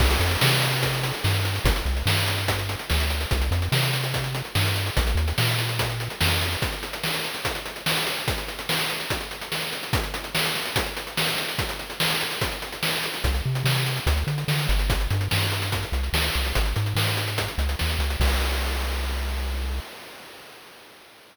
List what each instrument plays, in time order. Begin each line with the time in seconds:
0.00 synth bass 1 C2, kick, crash
0.10 closed hi-hat
0.20 synth bass 1 F2, closed hi-hat
0.31 closed hi-hat
0.41 synth bass 1 C3, snare
0.52 closed hi-hat
0.62 closed hi-hat
0.72 closed hi-hat
0.83 kick, closed hi-hat
0.93 closed hi-hat
1.03 closed hi-hat
1.14 closed hi-hat
1.24 synth bass 1 G2, snare
1.34 closed hi-hat
1.45 closed hi-hat
1.55 closed hi-hat
1.64 synth bass 1 G1, kick, closed hi-hat
1.76 closed hi-hat
1.86 synth bass 1 C2, closed hi-hat
1.97 closed hi-hat
2.06 synth bass 1 G2, snare
2.17 closed hi-hat
2.28 closed hi-hat
2.38 closed hi-hat
2.48 kick, closed hi-hat
2.59 closed hi-hat
2.69 closed hi-hat
2.79 closed hi-hat
2.90 synth bass 1 D2, snare
3.00 closed hi-hat
3.10 closed hi-hat
3.21 closed hi-hat
3.31 synth bass 1 C2, kick, closed hi-hat
3.41 closed hi-hat
3.51 synth bass 1 F2, closed hi-hat
3.62 closed hi-hat
3.72 synth bass 1 C3, snare
3.83 closed hi-hat
3.93 closed hi-hat
4.04 closed hi-hat
4.14 kick, closed hi-hat
4.24 closed hi-hat
4.35 closed hi-hat
4.45 closed hi-hat
4.55 synth bass 1 G2, snare
4.66 closed hi-hat
4.76 closed hi-hat
4.86 closed hi-hat
4.97 synth bass 1 A#1, kick, closed hi-hat
5.07 closed hi-hat
5.15 synth bass 1 D#2, closed hi-hat
5.28 closed hi-hat
5.38 synth bass 1 A#2, snare
5.48 closed hi-hat
5.59 closed hi-hat
5.69 closed hi-hat
5.79 kick, closed hi-hat
5.90 closed hi-hat
6.00 closed hi-hat
6.10 closed hi-hat
6.21 synth bass 1 F2, snare
6.31 closed hi-hat
6.41 closed hi-hat
6.52 closed hi-hat
6.62 kick, closed hi-hat
6.72 closed hi-hat
6.83 closed hi-hat
6.93 closed hi-hat
7.04 snare
7.14 closed hi-hat
7.24 closed hi-hat
7.34 closed hi-hat
7.45 kick, closed hi-hat
7.55 closed hi-hat
7.66 closed hi-hat
7.76 closed hi-hat
7.86 snare
7.97 closed hi-hat
8.07 closed hi-hat
8.17 closed hi-hat
8.28 kick, closed hi-hat
8.38 closed hi-hat
8.48 closed hi-hat
8.59 closed hi-hat
8.69 snare
8.79 closed hi-hat
8.90 closed hi-hat
9.00 closed hi-hat
9.10 kick, closed hi-hat
9.21 closed hi-hat
9.31 closed hi-hat
9.41 closed hi-hat
9.52 snare
9.62 closed hi-hat
9.72 closed hi-hat
9.83 closed hi-hat
9.93 kick, closed hi-hat
10.03 closed hi-hat
10.14 closed hi-hat
10.24 closed hi-hat
10.35 snare
10.45 closed hi-hat
10.55 closed hi-hat
10.66 closed hi-hat
10.76 kick, closed hi-hat
10.86 closed hi-hat
10.97 closed hi-hat
11.07 closed hi-hat
11.17 snare
11.28 closed hi-hat
11.38 closed hi-hat
11.48 closed hi-hat
11.58 kick, closed hi-hat
11.69 closed hi-hat
11.79 closed hi-hat
11.90 closed hi-hat
12.00 snare
12.10 closed hi-hat
12.21 closed hi-hat
12.31 closed hi-hat
12.41 kick, closed hi-hat
12.52 closed hi-hat
12.62 closed hi-hat
12.72 closed hi-hat
12.83 snare
12.93 closed hi-hat
13.03 closed hi-hat
13.14 closed hi-hat
13.24 synth bass 1 C2, kick, closed hi-hat
13.34 closed hi-hat
13.46 synth bass 1 C3
13.55 closed hi-hat
13.64 synth bass 1 C3, snare
13.76 closed hi-hat
13.86 closed hi-hat
13.97 closed hi-hat
14.06 synth bass 1 D2, kick, closed hi-hat
14.17 closed hi-hat
14.27 synth bass 1 D3, closed hi-hat
14.38 closed hi-hat
14.48 synth bass 1 D3, snare
14.59 closed hi-hat
14.69 synth bass 1 G1, closed hi-hat
14.79 closed hi-hat
14.90 kick, closed hi-hat
15.00 closed hi-hat
15.10 synth bass 1 G2, closed hi-hat
15.21 closed hi-hat
15.31 synth bass 1 G2, snare
15.42 closed hi-hat
15.52 closed hi-hat
15.62 closed hi-hat
15.72 kick, closed hi-hat
15.83 closed hi-hat
15.92 synth bass 1 C2, closed hi-hat
16.03 closed hi-hat
16.13 synth bass 1 D2, snare
16.24 closed hi-hat
16.34 synth bass 1 C2, closed hi-hat
16.45 closed hi-hat
16.55 synth bass 1 G#1, kick, closed hi-hat
16.65 closed hi-hat
16.76 synth bass 1 G#2, closed hi-hat
16.86 closed hi-hat
16.95 synth bass 1 G#2, snare
17.07 closed hi-hat
17.17 closed hi-hat
17.28 closed hi-hat
17.38 kick, closed hi-hat
17.48 closed hi-hat
17.58 synth bass 1 C#2, closed hi-hat
17.69 closed hi-hat
17.79 synth bass 1 D#2, snare
17.90 closed hi-hat
17.99 synth bass 1 C#2, closed hi-hat
18.10 closed hi-hat
18.20 synth bass 1 C2, kick, crash